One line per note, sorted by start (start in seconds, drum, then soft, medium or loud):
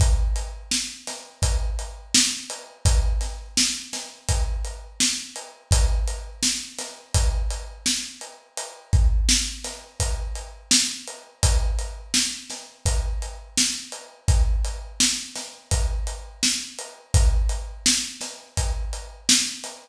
0.00 kick medium
0.00 closed hi-hat medium
0.36 closed hi-hat medium
0.71 snare medium
1.07 snare soft
1.07 closed hi-hat medium
1.42 kick medium
1.42 closed hi-hat medium
1.79 closed hi-hat medium
2.14 snare loud
2.50 closed hi-hat medium
2.85 kick medium
2.85 closed hi-hat medium
3.21 snare soft
3.21 closed hi-hat medium
3.57 snare medium
3.93 snare medium
3.93 closed hi-hat medium
4.29 kick medium
4.29 closed hi-hat medium
4.65 closed hi-hat medium
5.00 snare medium
5.36 closed hi-hat medium
5.71 kick medium
5.71 closed hi-hat medium
6.08 closed hi-hat medium
6.43 snare medium
6.78 snare soft
6.78 closed hi-hat medium
7.14 kick medium
7.14 closed hi-hat medium
7.50 closed hi-hat medium
7.86 snare medium
8.21 closed hi-hat medium
8.57 closed hi-hat medium
8.93 kick medium
8.93 closed hi-hat medium
9.29 snare medium
9.64 snare soft
9.64 closed hi-hat medium
10.00 kick medium
10.00 closed hi-hat medium
10.35 closed hi-hat medium
10.71 snare loud
11.07 closed hi-hat medium
11.43 kick medium
11.43 closed hi-hat loud
11.79 closed hi-hat medium
12.14 snare medium
12.50 snare soft
12.50 closed hi-hat medium
12.86 kick medium
12.86 closed hi-hat medium
13.22 closed hi-hat medium
13.57 snare medium
13.92 closed hi-hat medium
14.28 kick medium
14.28 closed hi-hat medium
14.65 closed hi-hat medium
15.00 snare medium
15.36 snare soft
15.36 closed hi-hat medium
15.71 kick medium
15.71 closed hi-hat medium
16.07 closed hi-hat medium
16.43 snare medium
16.79 closed hi-hat medium
17.14 kick medium
17.14 closed hi-hat medium
17.49 closed hi-hat medium
17.86 snare loud
18.21 snare soft
18.21 closed hi-hat medium
18.57 kick medium
18.57 closed hi-hat medium
18.93 closed hi-hat medium
19.29 snare loud
19.64 snare soft
19.64 closed hi-hat medium